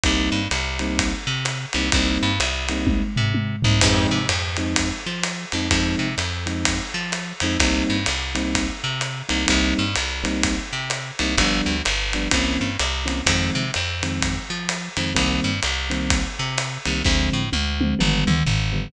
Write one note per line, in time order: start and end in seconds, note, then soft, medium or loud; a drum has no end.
0.04 0.30 C2 loud
0.04 0.40 G3 loud
0.04 0.40 A#3 loud
0.04 0.40 C4 loud
0.04 0.40 D#4 loud
0.04 kick medium
0.04 ride medium
0.32 0.48 G2 medium
0.51 1.14 C2 medium
0.51 hi-hat pedal medium
0.51 ride medium
0.79 1.10 G3 loud
0.79 1.10 A#3 loud
0.79 1.10 C4 loud
0.79 1.10 D#4 medium
0.79 ride medium
0.99 kick medium
0.99 ride loud
1.27 1.66 C3 medium
1.45 hi-hat pedal medium
1.45 ride medium
1.73 1.91 C2 medium
1.73 1.88 G3 loud
1.73 1.88 A#3 loud
1.73 1.88 C4 loud
1.73 1.88 D#4 medium
1.73 ride medium
1.92 2.18 C2 loud
1.92 2.29 G3 loud
1.92 2.29 A#3 loud
1.92 2.29 C4 loud
1.92 2.29 D#4 loud
1.92 kick medium
1.92 ride loud
2.23 2.39 G2 loud
2.40 3.03 C2 loud
2.40 hi-hat pedal medium
2.40 ride medium
2.69 3.00 G3 loud
2.69 3.00 A#3 loud
2.69 3.00 C4 loud
2.69 3.00 D#4 medium
2.69 ride medium
2.87 kick medium
2.87 high tom medium
3.16 3.56 C3 medium
3.16 floor tom medium
3.34 high tom medium
3.62 3.81 C2 loud
3.62 3.77 G3 medium
3.62 3.77 A#3 medium
3.62 3.77 C4 medium
3.62 3.77 D#4 loud
3.62 floor tom loud
3.81 4.07 F2 loud
3.81 4.18 F3 loud
3.81 4.18 G#3 loud
3.81 4.18 C4 loud
3.81 4.18 D#4 loud
3.81 kick medium
3.81 crash loud
3.81 ride loud
4.11 4.27 C3 medium
4.29 4.92 F2 loud
4.29 hi-hat pedal medium
4.29 ride medium
4.57 4.88 F3 loud
4.57 4.88 G#3 loud
4.57 4.88 C4 loud
4.57 4.88 D#4 loud
4.57 ride medium
4.76 kick medium
4.76 ride loud
5.06 5.45 F3 medium
5.23 hi-hat pedal medium
5.23 ride medium
5.52 5.69 F2 medium
5.52 5.66 F3 medium
5.52 5.66 G#3 medium
5.52 5.66 C4 medium
5.52 5.66 D#4 loud
5.52 ride medium
5.71 5.95 F2 loud
5.71 6.07 F3 loud
5.71 6.07 G#3 loud
5.71 6.07 C4 loud
5.71 6.07 D#4 loud
5.71 kick medium
5.71 ride loud
5.99 6.15 C3 medium
6.18 6.81 F2 medium
6.18 hi-hat pedal medium
6.18 ride medium
6.46 6.77 F3 medium
6.46 6.77 G#3 medium
6.46 6.77 C4 loud
6.46 6.77 D#4 medium
6.46 ride medium
6.65 kick medium
6.65 ride loud
6.94 7.33 F3 medium
7.12 hi-hat pedal medium
7.12 ride medium
7.40 7.58 F2 medium
7.40 7.56 F3 loud
7.40 7.56 G#3 loud
7.40 7.56 C4 loud
7.40 7.56 D#4 loud
7.40 ride medium
7.60 7.83 C2 loud
7.60 7.96 G3 loud
7.60 7.96 A#3 loud
7.60 7.96 C4 loud
7.60 7.96 D#4 loud
7.60 kick medium
7.60 ride loud
7.90 8.06 G2 medium
8.06 8.71 C2 medium
8.06 hi-hat pedal medium
8.06 ride medium
8.35 8.65 G3 loud
8.35 8.65 A#3 medium
8.35 8.65 C4 loud
8.35 8.65 D#4 loud
8.35 ride medium
8.55 kick medium
8.55 ride loud
8.84 9.23 C3 medium
9.01 hi-hat pedal medium
9.01 ride medium
9.29 9.46 C2 medium
9.29 9.42 G3 medium
9.29 9.42 A#3 medium
9.29 9.42 C4 medium
9.29 9.42 D#4 loud
9.29 ride medium
9.47 9.74 C2 loud
9.47 9.82 G3 loud
9.47 9.82 A#3 loud
9.47 9.82 C4 loud
9.47 9.82 D#4 loud
9.47 kick medium
9.47 ride loud
9.79 9.95 G2 medium
9.95 10.60 C2 medium
9.95 hi-hat pedal medium
9.95 ride medium
10.24 10.54 G3 loud
10.24 10.54 A#3 loud
10.24 10.54 C4 loud
10.24 10.54 D#4 loud
10.24 ride medium
10.43 kick medium
10.43 ride loud
10.73 11.12 C3 medium
10.90 hi-hat pedal medium
10.90 ride medium
11.19 11.36 C2 loud
11.19 11.33 G3 medium
11.19 11.33 A#3 loud
11.19 11.33 C4 medium
11.19 11.33 D#4 loud
11.19 ride medium
11.38 11.61 G1 loud
11.38 11.74 F3 loud
11.38 11.74 G3 loud
11.38 11.74 B3 loud
11.38 11.74 D4 loud
11.38 kick medium
11.38 ride loud
11.66 11.82 D2 medium
11.85 12.28 G1 medium
11.85 hi-hat pedal medium
11.85 ride medium
12.13 12.28 F3 medium
12.13 12.28 G3 medium
12.13 12.28 B3 loud
12.13 12.28 D4 loud
12.13 ride medium
12.31 12.57 C2 medium
12.31 12.67 E3 loud
12.31 12.67 A#3 loud
12.31 12.67 C4 loud
12.31 12.67 C#4 loud
12.31 kick medium
12.31 ride loud
12.61 12.77 G2 medium
12.79 13.22 C2 loud
12.79 hi-hat pedal medium
12.79 ride medium
13.06 13.19 E3 medium
13.06 13.19 A#3 medium
13.06 13.19 C4 loud
13.06 13.19 C#4 loud
13.06 ride medium
13.26 13.50 F2 loud
13.26 13.62 D#3 loud
13.26 13.62 F3 loud
13.26 13.62 G#3 loud
13.26 13.62 C4 loud
13.26 kick medium
13.26 ride loud
13.55 13.71 C3 medium
13.74 14.39 F2 medium
13.74 hi-hat pedal medium
13.74 ride medium
14.03 14.33 D#3 loud
14.03 14.33 F3 loud
14.03 14.33 G#3 medium
14.03 14.33 C4 loud
14.03 ride medium
14.21 kick medium
14.21 ride medium
14.50 14.89 F3 medium
14.69 hi-hat pedal medium
14.69 ride medium
14.97 15.13 F2 medium
14.97 15.11 D#3 loud
14.97 15.11 F3 loud
14.97 15.11 G#3 medium
14.97 15.11 C4 medium
14.97 ride medium
15.14 15.40 C2 loud
15.14 15.50 D#3 loud
15.14 15.50 G3 loud
15.14 15.50 A#3 loud
15.14 15.50 C4 loud
15.14 kick medium
15.14 ride medium
15.44 15.60 G2 medium
15.63 16.27 C2 medium
15.63 hi-hat pedal medium
15.63 ride medium
15.90 16.20 D#3 loud
15.90 16.20 G3 loud
15.90 16.20 A#3 loud
15.90 16.20 C4 loud
15.90 ride medium
16.10 kick medium
16.10 ride loud
16.39 16.78 C3 medium
16.58 hi-hat pedal medium
16.58 ride medium
16.85 17.03 C2 medium
16.85 16.99 D#3 loud
16.85 16.99 G3 medium
16.85 16.99 A#3 loud
16.85 16.99 C4 medium
16.85 ride medium
17.05 17.30 D2 loud
17.05 17.41 D3 loud
17.05 17.41 F3 loud
17.05 17.41 G#3 loud
17.05 17.41 C4 loud
17.05 kick medium
17.05 snare medium
17.33 17.50 A2 medium
17.53 17.94 D2 loud
17.53 high tom medium
17.81 17.94 D3 medium
17.81 17.94 F3 medium
17.81 17.94 G#3 medium
17.81 17.94 C4 loud
17.81 high tom medium
17.99 18.24 G1 loud
17.99 18.35 D3 loud
17.99 18.35 F3 loud
17.99 18.35 G3 loud
17.99 18.35 B3 loud
17.99 mid tom medium
18.27 18.43 D2 medium
18.27 mid tom loud
18.46 18.88 G1 medium
18.46 floor tom medium
18.73 18.86 D3 medium
18.73 18.86 F3 loud
18.73 18.86 G3 loud
18.73 18.86 B3 loud